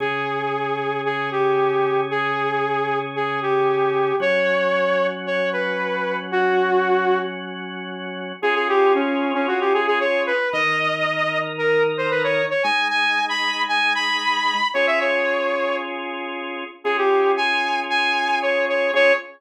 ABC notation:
X:1
M:4/4
L:1/16
Q:1/4=114
K:Db
V:1 name="Lead 2 (sawtooth)"
A8 A2 =G6 | A8 A2 =G6 | d8 d2 =B6 | G8 z8 |
A A =G2 D3 D _G =G A A d2 =B2 | e8 B2 z c =B d2 d | a2 a3 =b3 a2 b6 | d =e d6 z8 |
A =G3 a4 a4 d2 d2 | d4 z12 |]
V:2 name="Drawbar Organ"
[D,DA]16- | [D,DA]16 | [G,DG]16- | [G,DG]16 |
[DFA]16 | [E,EB]16 | [A,EA]16 | [DFA]16 |
[DFA]16 | [DFA]4 z12 |]